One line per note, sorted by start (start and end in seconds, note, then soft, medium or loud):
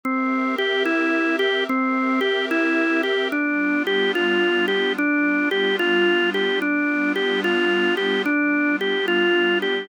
0.04 1.66 C4 medium
0.04 0.56 C4 medium
0.04 1.66 G4 medium
0.04 1.66 A#4 medium
0.04 1.66 E5 medium
0.58 0.83 G4 medium
0.85 1.36 E4 medium
1.39 1.64 G4 medium
1.67 3.30 C4 medium
1.67 2.20 C4 medium
1.67 3.30 G4 medium
1.67 3.30 A#4 medium
1.67 3.30 E5 medium
2.21 2.46 G4 medium
2.51 3.02 E4 medium
3.03 3.28 G4 medium
3.32 4.96 G3 medium
3.32 4.96 B3 medium
3.32 3.83 D4 medium
3.32 4.96 D4 medium
3.32 4.96 F4 medium
3.87 4.12 G4 medium
4.15 4.66 F4 medium
4.68 4.93 G4 medium
4.97 6.61 G3 medium
4.97 6.61 B3 medium
4.97 6.61 D4 medium
4.97 5.49 D4 medium
4.97 6.61 F4 medium
5.51 5.76 G4 medium
5.79 6.30 F4 medium
6.34 6.59 G4 medium
6.61 8.25 G3 medium
6.61 8.25 B3 medium
6.61 8.25 D4 medium
6.61 7.13 D4 medium
6.61 8.25 F4 medium
7.16 7.41 G4 medium
7.44 7.95 F4 medium
7.97 8.22 G4 medium
8.26 9.89 G3 medium
8.26 9.89 B3 medium
8.26 8.76 D4 medium
8.26 9.89 D4 medium
8.26 9.89 F4 medium
8.81 9.06 G4 medium
9.08 9.59 F4 medium
9.62 9.87 G4 medium